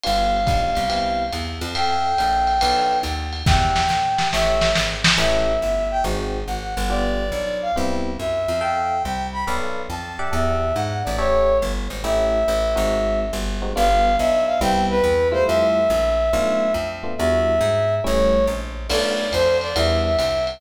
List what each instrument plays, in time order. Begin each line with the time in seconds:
0.04 electric bass (finger) G1, electric piano 1 B3 D4 F4 G4, brass section F5, ride
0.47 electric bass (finger) B1, electric piano 1 B3 D4 F4 G4, kick, hi-hat pedal, ride
0.75 electric bass (finger) C2, ride
0.89 electric piano 1 B3 C4 E4 G4, ride
1.33 electric bass (finger) E2, hi-hat pedal, ride
1.61 electric bass (finger) F2, ride
1.75 electric piano 1 A4 E5 F5 G5, brass section G5, ride
2.18 electric bass (finger) A#1, electric piano 1 A4 E5 F5 G5, hi-hat pedal, ride
2.47 ride
2.61 electric bass (finger) B1, electric piano 1 A4 B4 D5 F5, ride
3.03 electric bass (finger) D#2, hi-hat pedal, ride
3.33 ride
3.46 electric bass (finger) E2, electric piano 1 G4 D5 E5 F#5, brass section G5, kick, snare
3.76 snare
3.89 electric bass (finger) A#2, snare
4.18 electric piano 1 G4 D5 E5 F#5, snare
4.32 electric bass (finger) A1, electric piano 1 G4 A4 C#5 E5, brass section E5, snare
4.61 snare
4.75 electric bass (finger) G#1, snare
5.04 snare
5.18 electric bass (finger) A1, electric piano 1 C#4 E4 G4 A4, brass section E5
5.62 electric bass (finger) G1, brass section E5
5.91 brass section G5
6.04 electric bass (finger) G#1, electric piano 1 C4 D#4 F#4 G#4
6.47 electric bass (finger) G#1, brass section F#5
6.77 electric bass (finger) G1
6.89 electric piano 1 B3 D4 F4 G4, brass section D5
7.32 electric bass (finger) B1, brass section D5
7.62 brass section F5
7.76 electric bass (finger) C2, electric piano 1 B3 C4 E4 G4
8.19 electric bass (finger) F#2, brass section E5
8.48 electric bass (finger) F2
8.61 electric piano 1 A4 E5 F5 G5, brass section G5
9.03 electric bass (finger) C2, brass section G5
9.33 brass section B5
9.47 electric bass (finger) B1, electric piano 1 A4 B4 D5 F5
9.90 electric bass (finger) F2, brass section A5
10.19 electric piano 1 G4 D5 E5 F#5
10.33 electric bass (finger) E2, brass section E5
10.75 electric bass (finger) G#2, brass section F#5
11.04 electric bass (finger) A1, brass section D5
11.18 electric piano 1 G4 A4 C#5 E5, brass section C#5
11.62 electric bass (finger) G1
11.90 electric bass (finger) G#1
12.04 electric bass (finger) A1, electric piano 1 A3 C#4 E4 G4, brass section E5
12.48 electric bass (finger) A1
12.76 electric bass (finger) G#1, electric piano 1 G#3 C4 D#4 F#4
13.33 electric bass (finger) G1
13.62 electric piano 1 G#3 C4 D#4 F#4
13.76 electric bass (finger) G1, electric piano 1 G3 B3 D4 F4, brass section F5
14.18 electric bass (finger) B1, brass section E5
14.47 brass section F5
14.61 electric bass (finger) C2, electric piano 1 G3 B3 C4 E4, brass section G5
14.90 brass section B4
15.04 electric bass (finger) E2
15.32 electric piano 1 G3 A3 E4 F4, brass section C5
15.47 electric bass (finger) F2, brass section E5
15.90 electric bass (finger) A#1
16.33 electric bass (finger) B1, electric piano 1 A3 B3 D4 F4
16.74 electric bass (finger) F2
17.03 electric piano 1 A3 B3 D4 F4
17.18 electric bass (finger) E2, electric piano 1 G3 D4 E4 F#4, brass section E5
17.61 electric bass (finger) G#2
18.04 electric bass (finger) A1, electric piano 1 G3 A3 C#4 E4, brass section C#5
18.47 electric bass (finger) A#1
18.89 electric bass (finger) B1, electric piano 1 A3 B3 D4 F4, brass section D5, crash, ride
19.32 electric bass (finger) F2, brass section C5, hi-hat pedal, ride
19.61 brass section D5, ride
19.75 electric bass (finger) E2, electric piano 1 G3 B3 D4 E4, brass section E5, ride
20.05 brass section E5
20.19 electric bass (finger) C2, hi-hat pedal, ride
20.47 ride